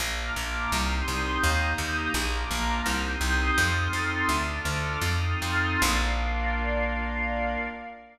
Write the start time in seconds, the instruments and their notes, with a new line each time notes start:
0.00 electric bass (finger) A#1, pad 5 (bowed) A#3 D4 F4, pad 2 (warm) A#5 D6 F6
0.36 electric bass (finger) A#1
0.71 electric bass (finger) C2, pad 5 (bowed) C4 D#4 G4, pad 2 (warm) C6 D#6 G6
1.08 electric bass (finger) C2
1.41 electric bass (finger) D#2, pad 5 (bowed) A#3 D#4 G4, pad 2 (warm) A#5 D#6 G6
1.78 electric bass (finger) D#2
2.14 electric bass (finger) A#1, pad 5 (bowed) A#3 D4 F4, pad 2 (warm) A#5 D6 F6
2.51 electric bass (finger) A#1
2.86 electric bass (finger) C2, pad 5 (bowed) C4 D#4 G4, pad 2 (warm) C6 D#6 G6
3.21 electric bass (finger) C2
3.56 electric bass (finger) F2, pad 5 (bowed) C4 D#4 F4 A4, pad 2 (warm) C6 D#6 F6 A6
3.93 electric bass (finger) F2
4.27 electric bass (finger) D2, pad 5 (bowed) D4 F4 A4, pad 2 (warm) D6 F6 A6
4.65 electric bass (finger) D2
5.01 electric bass (finger) F2, pad 5 (bowed) C4 D#4 F4 A4, pad 2 (warm) C6 D#6 F6 A6
5.42 electric bass (finger) F2
5.82 electric bass (finger) A#1, pad 5 (bowed) A#3 D4 F4, pad 2 (warm) A#4 D5 F5